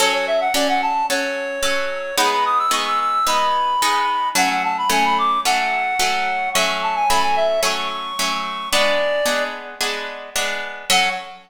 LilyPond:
<<
  \new Staff \with { instrumentName = "Clarinet" } { \time 4/4 \key fis \minor \tempo 4 = 110 cis''16 cis''16 e''16 fis''16 d''16 fis''16 a''8 cis''2 | b''16 b''16 dis'''16 e'''16 cis'''16 e'''16 e'''8 b''2 | fis''16 fis''16 a''16 b''16 gis''16 b''16 d'''8 fis''2 | cis'''16 cis'''16 a''16 gis''16 b''16 gis''16 e''8 cis'''2 |
d''4. r2 r8 | fis''4 r2. | }
  \new Staff \with { instrumentName = "Orchestral Harp" } { \time 4/4 \key fis \minor <fis cis' a'>4 <fis cis' a'>4 <fis cis' a'>4 <fis cis' a'>4 | <gis b dis'>4 <gis b dis'>4 <gis b dis'>4 <gis b dis'>4 | <fis a cis'>4 <fis a cis'>4 <fis a cis'>4 <fis a cis'>4 | <fis a cis'>4 <fis a cis'>4 <fis a cis'>4 <fis a cis'>4 |
<gis b d'>4 <gis b d'>4 <gis b d'>4 <gis b d'>4 | <fis cis' a'>4 r2. | }
>>